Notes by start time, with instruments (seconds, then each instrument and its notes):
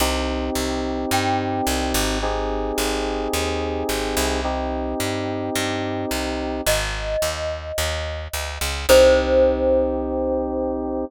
0.00 electric bass (finger) C2, electric piano 2 C4 D#4 G4
0.55 electric bass (finger) C2
1.11 electric bass (finger) G2, glockenspiel G5
1.67 electric bass (finger) C2
1.94 electric bass (finger) G#1
2.22 electric piano 2 C4 D#4 G4 G#4
2.78 electric bass (finger) G#1
3.33 electric bass (finger) D#2
3.89 electric bass (finger) G#1
4.17 electric bass (finger) C2
4.44 electric piano 2 C4 D#4 G4
5.00 electric bass (finger) G2
5.55 electric bass (finger) G2
6.11 electric bass (finger) C2
6.66 electric bass (finger) G#1, glockenspiel D#5
7.22 electric bass (finger) D#2
7.78 electric bass (finger) D#2
8.33 electric bass (finger) D2
8.61 electric bass (finger) C#2
8.89 electric bass (finger) C2, electric piano 2 C4 D#4 G4, glockenspiel C5